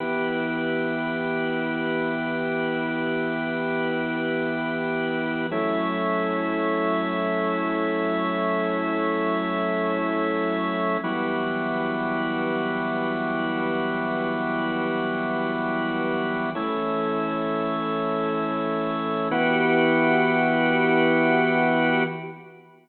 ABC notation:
X:1
M:4/4
L:1/8
Q:1/4=87
K:Edor
V:1 name="Drawbar Organ"
[E,B,G]8- | [E,B,G]8 | [F,A,CE]8- | [F,A,CE]8 |
[E,F,G,B,]8- | [E,F,G,B,]8 | [E,A,C]8 | [E,B,FG]8 |]
V:2 name="Drawbar Organ"
[EGB]8- | [EGB]8 | [F,EAc]8- | [F,EAc]8 |
[EFGB]8- | [EFGB]8 | [EAc]8 | [EFGB]8 |]